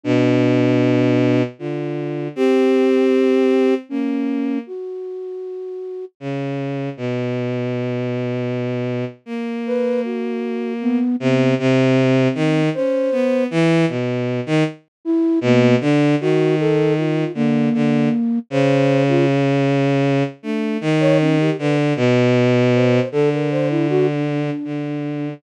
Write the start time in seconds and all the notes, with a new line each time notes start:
0.04 B2 D4
1.59 D3 F4
2.36 C4 G4
3.89 A#3 C#4
4.67 F#4
6.20 C#3
6.97 B2
9.26 A#3
9.67 B4
10.04 F#4
10.81 B3
11.20 C3 B3
11.59 C3 C4
12.35 D#3
12.74 C#4 C5
13.12 B3
13.51 E3
13.88 B2
14.46 D#3
15.05 E4
15.41 B2 A#3
15.81 D3 D4
16.21 D#3 F#4
16.60 A4
16.98 F4
17.34 D3 A#3
17.74 D3
18.50 C#3 C5
19.08 F4
20.43 A3 D4
20.81 D#3
21.00 C#5
21.20 C#4
21.39 G4
21.59 D3 B4
21.96 B2
22.74 C5
23.12 D3 A4
23.33 A#4
23.51 C5
23.70 E4
23.90 F#4
24.08 D4
24.64 D3